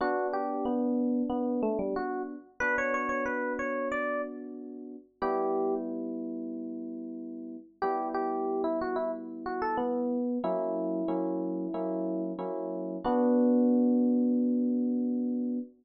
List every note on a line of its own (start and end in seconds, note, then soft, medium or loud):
0.01 2.35 B3 loud
0.01 2.35 D4 loud
0.01 0.27 F#4 medium
0.33 0.65 G4 medium
0.65 1.23 B3 medium
1.30 1.61 B3 medium
1.63 1.78 A3 medium
1.79 1.94 G3 medium
1.96 2.22 F#4 medium
2.60 4.96 B3 medium
2.60 4.96 D4 medium
2.60 4.96 F#4 medium
2.60 2.76 B4 loud
2.78 2.93 C#5 medium
2.94 3.09 C#5 medium
3.09 3.25 C#5 medium
3.26 3.53 B4 medium
3.59 3.88 C#5 medium
3.92 4.22 D5 medium
5.22 7.57 G3 medium
5.22 7.57 B3 loud
5.22 7.57 E4 loud
5.22 5.74 G4 medium
7.82 10.17 G3 medium
7.82 10.17 B3 medium
7.82 10.17 E4 medium
7.82 8.08 G4 medium
8.14 8.62 G4 medium
8.64 8.79 E4 medium
8.81 8.97 F#4 medium
8.96 9.11 E4 medium
9.46 9.61 F#4 medium
9.62 9.77 A4 medium
9.77 10.38 B3 medium
10.44 11.02 F#3 loud
10.44 11.02 A#3 loud
10.44 11.02 C#4 medium
10.44 12.23 E4 medium
11.08 11.67 F#3 medium
11.08 11.67 A#3 medium
11.08 11.67 C#4 medium
11.08 11.67 E4 medium
11.74 12.33 F#3 medium
11.74 12.33 A#3 medium
11.74 12.33 C#4 medium
11.74 12.33 E4 medium
12.39 12.97 F#3 medium
12.39 12.97 A#3 medium
12.39 12.97 C#4 medium
12.39 12.97 E4 medium
13.04 15.60 B3 loud
13.04 15.58 D4 loud
13.04 15.58 F#4 medium